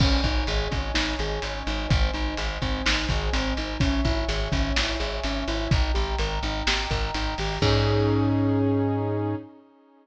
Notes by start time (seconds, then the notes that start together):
0.00 G#1 C#4 C#5 D#5 G#5, kick, crash
0.24 G#1 D#4, kick, closed hi-hat
0.47 G#1 G#4, closed hi-hat
0.71 G#1 C#4, kick, closed hi-hat
0.94 G#1 D#4, snare
1.19 G#1 G#4, closed hi-hat
1.42 G#1 C#4, closed hi-hat
1.67 G#1 D#4, closed hi-hat
1.89 G#1 C4 C5 D#5 G#5, kick, closed hi-hat
2.13 G#1 D#4, closed hi-hat
2.37 G#1 G#4, closed hi-hat
2.62 G#1 C4, kick, closed hi-hat
2.85 G#1 D#4, snare
3.09 G#1 G#4, kick, closed hi-hat
3.33 G#1 C4, closed hi-hat
3.57 G#1 D#4, closed hi-hat
3.80 G#1 C#4 C#5 E5 G#5, kick, closed hi-hat
4.05 G#1 E4, kick, closed hi-hat
4.28 G#1 G#4, closed hi-hat
4.52 G#1 C#4, kick, closed hi-hat
4.75 G#1 E4, snare
4.99 G#1 G#4, closed hi-hat
5.24 G#1 C#4, closed hi-hat
5.48 G#1 E4, closed hi-hat
5.70 G#1 D#4 D#5 G5 A#5, kick, closed hi-hat
5.94 G#1 G4, closed hi-hat
6.18 G#1 A#4, closed hi-hat
6.43 G#1 D#4, closed hi-hat
6.67 G#1 G4, snare
6.90 G#1 A#4, kick, closed hi-hat
7.14 G#1 D#4, closed hi-hat
7.38 G#1 G4, open hi-hat
7.62 G#2 C#4 D#4 G#4, kick, crash